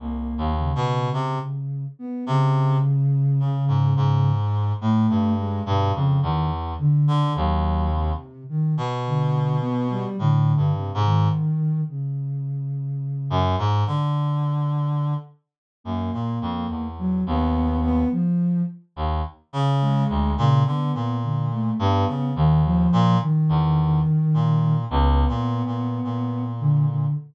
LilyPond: <<
  \new Staff \with { instrumentName = "Clarinet" } { \clef bass \time 6/4 \tempo 4 = 53 \tuplet 3/2 { c,8 dis,8 b,8 } c16 r8. c8 r8 cis16 gis,16 gis,8. a,16 g,8 g,16 f,16 e,8 | r16 d16 dis,8. r8 b,4~ b,16 \tuplet 3/2 { a,8 g,8 gis,8 } r4. r16 fis,16 | gis,16 d4~ d16 r8 fis,16 ais,16 f,16 e,8 dis,8. r8. dis,16 r16 cis8 d,16 | ais,16 d16 ais,8. g,16 cis16 dis,8 ais,16 r16 e,8 r16 ais,8 \tuplet 3/2 { cis,8 ais,8 ais,8 } ais,4 | }
  \new Staff \with { instrumentName = "Ocarina" } { \time 6/4 ais8 cis4~ cis16 b16 cis2 r16 a8 gis16 b,16 cis16 dis16 r16 | d8 fis8 c8 dis16 r16 d8 b16 g16 d8 c16 dis8. cis4. | r2 ais4 fis16 b8 b16 f8 r4 gis8 | cis16 b8 d16 a16 b8 dis16 f8 dis4. b4. d16 d16 | }
>>